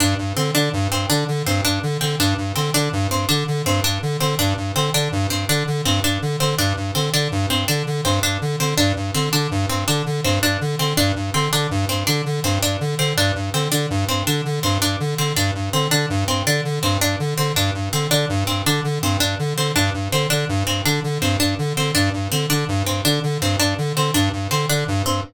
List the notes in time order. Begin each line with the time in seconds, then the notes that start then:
0.00 G2 D4
0.18 G2
0.37 D3 C4
0.55 D3 D4
0.73 G2
0.91 G2 C4
1.10 D3 D4
1.28 D3
1.46 G2 C4
1.65 G2 D4
1.83 D3
2.01 D3 C4
2.20 G2 D4
2.38 G2
2.56 D3 C4
2.74 D3 D4
2.93 G2
3.11 G2 C4
3.29 D3 D4
3.48 D3
3.66 G2 C4
3.84 G2 D4
4.02 D3
4.21 D3 C4
4.39 G2 D4
4.57 G2
4.76 D3 C4
4.94 D3 D4
5.12 G2
5.30 G2 C4
5.49 D3 D4
5.67 D3
5.85 G2 C4
6.04 G2 D4
6.22 D3
6.40 D3 C4
6.58 G2 D4
6.77 G2
6.95 D3 C4
7.13 D3 D4
7.32 G2
7.50 G2 C4
7.68 D3 D4
7.87 D3
8.05 G2 C4
8.23 G2 D4
8.41 D3
8.60 D3 C4
8.78 G2 D4
8.96 G2
9.14 D3 C4
9.33 D3 D4
9.51 G2
9.69 G2 C4
9.88 D3 D4
10.06 D3
10.24 G2 C4
10.43 G2 D4
10.61 D3
10.79 D3 C4
10.97 G2 D4
11.16 G2
11.34 D3 C4
11.52 D3 D4
11.71 G2
11.89 G2 C4
12.07 D3 D4
12.26 D3
12.44 G2 C4
12.62 G2 D4
12.80 D3
12.99 D3 C4
13.17 G2 D4
13.35 G2
13.54 D3 C4
13.72 D3 D4
13.90 G2
14.09 G2 C4
14.27 D3 D4
14.45 D3
14.63 G2 C4
14.82 G2 D4
15.00 D3
15.18 D3 C4
15.36 G2 D4
15.55 G2
15.73 D3 C4
15.91 D3 D4
16.10 G2
16.28 G2 C4
16.46 D3 D4
16.65 D3
16.83 G2 C4
17.01 G2 D4
17.20 D3
17.38 D3 C4
17.56 G2 D4
17.74 G2
17.93 D3 C4
18.11 D3 D4
18.29 G2
18.47 G2 C4
18.66 D3 D4
18.84 D3
19.02 G2 C4
19.20 G2 D4
19.39 D3
19.57 D3 C4
19.76 G2 D4
19.94 G2
20.12 D3 C4
20.30 D3 D4
20.49 G2
20.67 G2 C4
20.85 D3 D4
21.04 D3
21.22 G2 C4
21.40 G2 D4
21.59 D3
21.77 D3 C4
21.95 G2 D4
22.13 G2
22.32 D3 C4
22.50 D3 D4
22.68 G2
22.86 G2 C4
23.05 D3 D4
23.23 D3
23.41 G2 C4
23.60 G2 D4
23.78 D3
23.96 D3 C4
24.14 G2 D4
24.33 G2
24.51 D3 C4
24.69 D3 D4
24.88 G2
25.06 G2 C4